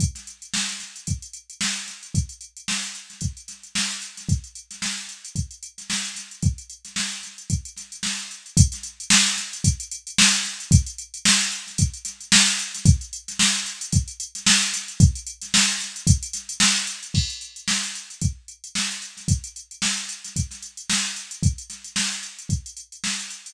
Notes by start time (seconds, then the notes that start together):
0.00 kick, closed hi-hat
0.15 snare, closed hi-hat
0.27 closed hi-hat
0.42 closed hi-hat
0.54 snare
0.69 snare, closed hi-hat
0.80 snare, closed hi-hat
0.96 closed hi-hat
1.07 kick, closed hi-hat
1.22 closed hi-hat
1.33 closed hi-hat
1.50 closed hi-hat
1.61 snare
1.76 closed hi-hat
1.88 snare, closed hi-hat
2.03 closed hi-hat
2.15 kick, closed hi-hat
2.29 closed hi-hat
2.41 closed hi-hat
2.57 closed hi-hat
2.68 snare
2.83 closed hi-hat
2.95 closed hi-hat
3.10 snare, closed hi-hat
3.21 kick, closed hi-hat
3.37 closed hi-hat
3.48 snare, closed hi-hat
3.63 closed hi-hat
3.75 snare
3.91 closed hi-hat
4.02 closed hi-hat
4.17 snare, closed hi-hat
4.29 kick, closed hi-hat
4.44 closed hi-hat
4.55 closed hi-hat
4.71 snare, closed hi-hat
4.82 snare
4.98 closed hi-hat
5.09 closed hi-hat
5.25 closed hi-hat
5.35 kick, closed hi-hat
5.51 closed hi-hat
5.63 closed hi-hat
5.78 snare, closed hi-hat
5.90 snare
6.04 closed hi-hat
6.16 snare, closed hi-hat
6.31 closed hi-hat
6.42 kick, closed hi-hat
6.58 closed hi-hat
6.70 closed hi-hat
6.85 snare, closed hi-hat
6.96 snare
7.12 closed hi-hat
7.23 snare, closed hi-hat
7.38 closed hi-hat
7.50 kick, closed hi-hat
7.65 closed hi-hat
7.76 snare, closed hi-hat
7.92 closed hi-hat
8.03 snare
8.19 closed hi-hat
8.31 closed hi-hat
8.46 closed hi-hat
8.57 kick, closed hi-hat
8.72 snare, closed hi-hat
8.83 closed hi-hat
9.00 closed hi-hat
9.10 snare
9.26 snare, closed hi-hat
9.37 snare, closed hi-hat
9.53 closed hi-hat
9.64 kick, closed hi-hat
9.80 closed hi-hat
9.91 closed hi-hat
10.07 closed hi-hat
10.18 snare
10.34 closed hi-hat
10.45 snare, closed hi-hat
10.60 closed hi-hat
10.71 kick, closed hi-hat
10.86 closed hi-hat
10.98 closed hi-hat
11.14 closed hi-hat
11.25 snare
11.40 closed hi-hat
11.52 closed hi-hat
11.67 snare, closed hi-hat
11.78 kick, closed hi-hat
11.94 closed hi-hat
12.05 snare, closed hi-hat
12.21 closed hi-hat
12.32 snare
12.47 closed hi-hat
12.59 closed hi-hat
12.74 snare, closed hi-hat
12.85 kick, closed hi-hat
13.01 closed hi-hat
13.13 closed hi-hat
13.28 snare, closed hi-hat
13.39 snare
13.54 closed hi-hat
13.66 closed hi-hat
13.81 closed hi-hat
13.92 kick, closed hi-hat
14.08 closed hi-hat
14.20 closed hi-hat
14.35 snare, closed hi-hat
14.46 snare
14.62 closed hi-hat
14.73 snare, closed hi-hat
14.88 closed hi-hat
15.00 kick, closed hi-hat
15.15 closed hi-hat
15.27 closed hi-hat
15.42 snare, closed hi-hat
15.54 snare
15.69 closed hi-hat
15.80 snare, closed hi-hat
15.96 closed hi-hat
16.07 kick, closed hi-hat
16.23 closed hi-hat
16.33 snare, closed hi-hat
16.49 closed hi-hat
16.60 snare
16.76 closed hi-hat
16.87 closed hi-hat
17.03 closed hi-hat
17.14 kick, crash
17.30 closed hi-hat
17.41 closed hi-hat
17.56 closed hi-hat
17.68 snare
17.83 closed hi-hat
17.95 closed hi-hat
18.10 closed hi-hat
18.21 kick, closed hi-hat
18.48 closed hi-hat
18.64 closed hi-hat
18.75 snare
18.91 closed hi-hat
19.02 closed hi-hat
19.17 snare, closed hi-hat
19.28 kick, closed hi-hat
19.44 closed hi-hat
19.56 closed hi-hat
19.71 closed hi-hat
19.82 snare
19.97 closed hi-hat
20.09 closed hi-hat
20.25 snare, closed hi-hat
20.36 kick, closed hi-hat
20.51 snare, closed hi-hat
20.62 closed hi-hat
20.77 closed hi-hat
20.90 snare
21.05 closed hi-hat
21.16 closed hi-hat
21.31 closed hi-hat
21.43 kick, closed hi-hat
21.58 closed hi-hat
21.70 snare, closed hi-hat
21.84 closed hi-hat
21.96 snare
22.11 closed hi-hat
22.23 closed hi-hat
22.39 closed hi-hat
22.49 kick, closed hi-hat
22.66 closed hi-hat
22.77 closed hi-hat
22.92 closed hi-hat
23.04 snare
23.19 closed hi-hat
23.30 closed hi-hat
23.46 closed hi-hat